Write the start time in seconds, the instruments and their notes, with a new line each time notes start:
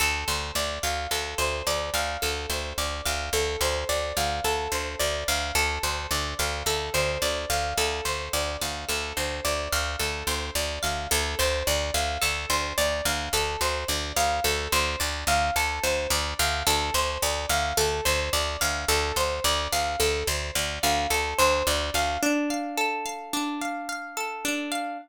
0.00 electric bass (finger) D2, pizzicato strings A4
0.28 electric bass (finger) D2, pizzicato strings C5
0.55 electric bass (finger) D2, pizzicato strings D5
0.83 electric bass (finger) D2, pizzicato strings F5
1.11 electric bass (finger) D2, pizzicato strings A4
1.38 electric bass (finger) D2, pizzicato strings C5
1.67 electric bass (finger) D2, pizzicato strings D5
1.94 electric bass (finger) D2, pizzicato strings F5
2.22 electric bass (finger) D2, pizzicato strings A4
2.50 electric bass (finger) D2, pizzicato strings C5
2.78 electric bass (finger) D2, pizzicato strings D5
3.05 electric bass (finger) D2, pizzicato strings F5
3.33 electric bass (finger) D2, pizzicato strings A4
3.61 electric bass (finger) D2, pizzicato strings C5
3.89 electric bass (finger) D2, pizzicato strings D5
4.17 electric bass (finger) D2, pizzicato strings F5
4.44 electric bass (finger) D2, pizzicato strings A4
4.72 electric bass (finger) D2, pizzicato strings C5
4.99 electric bass (finger) D2, pizzicato strings D5
5.28 electric bass (finger) D2, pizzicato strings F5
5.55 electric bass (finger) D2, pizzicato strings A4
5.83 electric bass (finger) D2, pizzicato strings C5
6.11 electric bass (finger) D2, pizzicato strings D5
6.39 electric bass (finger) D2, pizzicato strings F5
6.66 electric bass (finger) D2, pizzicato strings A4
6.94 electric bass (finger) D2, pizzicato strings C5
7.22 electric bass (finger) D2, pizzicato strings D5
7.50 electric bass (finger) D2, pizzicato strings F5
7.78 electric bass (finger) D2, pizzicato strings A4
8.05 electric bass (finger) D2, pizzicato strings C5
8.33 electric bass (finger) D2, pizzicato strings D5
8.61 electric bass (finger) D2, pizzicato strings F5
8.89 electric bass (finger) D2, pizzicato strings A4
9.17 electric bass (finger) D2, pizzicato strings C5
9.45 electric bass (finger) D2, pizzicato strings D5
9.72 electric bass (finger) D2, pizzicato strings F5
9.99 electric bass (finger) D2, pizzicato strings A4
10.27 electric bass (finger) D2, pizzicato strings C5
10.55 electric bass (finger) D2, pizzicato strings D5
10.83 electric bass (finger) D2, pizzicato strings F5
11.11 electric bass (finger) D2, pizzicato strings A4
11.39 electric bass (finger) D2, pizzicato strings C5
11.67 electric bass (finger) D2, pizzicato strings D5
11.94 electric bass (finger) D2, pizzicato strings F5
12.22 electric bass (finger) D2, pizzicato strings A4
12.50 electric bass (finger) D2, pizzicato strings C5
12.78 electric bass (finger) D2, pizzicato strings D5
13.05 electric bass (finger) D2, pizzicato strings F5
13.33 electric bass (finger) D2, pizzicato strings A4
13.61 electric bass (finger) D2, pizzicato strings C5
13.88 electric bass (finger) D2, pizzicato strings D5
14.16 electric bass (finger) D2, pizzicato strings F5
14.44 electric bass (finger) D2, pizzicato strings A4
14.72 electric bass (finger) D2, pizzicato strings C5
15.00 electric bass (finger) D2, pizzicato strings D5
15.27 electric bass (finger) D2, pizzicato strings F5
15.56 electric bass (finger) D2, pizzicato strings A4
15.83 electric bass (finger) D2, pizzicato strings C5
16.10 electric bass (finger) D2, pizzicato strings D5
16.39 electric bass (finger) D2, pizzicato strings F5
16.67 electric bass (finger) D2, pizzicato strings A4
16.94 electric bass (finger) D2, pizzicato strings C5
17.22 electric bass (finger) D2, pizzicato strings D5
17.49 electric bass (finger) D2, pizzicato strings F5
17.77 electric bass (finger) D2, pizzicato strings A4
18.05 electric bass (finger) D2, pizzicato strings C5
18.33 electric bass (finger) D2, pizzicato strings D5
18.61 electric bass (finger) D2, pizzicato strings F5
18.88 electric bass (finger) D2, pizzicato strings A4
19.16 electric bass (finger) D2, pizzicato strings C5
19.44 electric bass (finger) D2, pizzicato strings D5
19.72 electric bass (finger) D2, pizzicato strings F5
20.00 electric bass (finger) D2, pizzicato strings A4
20.27 electric bass (finger) D2, pizzicato strings C5
20.55 electric bass (finger) D2, pizzicato strings D5
20.83 electric bass (finger) D2, pizzicato strings F5
21.10 electric bass (finger) D2, pizzicato strings A4
21.39 electric bass (finger) D2, pizzicato strings C5
21.67 electric bass (finger) D2, pizzicato strings D5
21.94 electric bass (finger) D2, pizzicato strings F5
22.23 pizzicato strings D4
22.50 pizzicato strings F5
22.77 pizzicato strings A4
23.06 pizzicato strings F5
23.33 pizzicato strings D4
23.61 pizzicato strings F5
23.89 pizzicato strings F5
24.17 pizzicato strings A4
24.45 pizzicato strings D4
24.72 pizzicato strings F5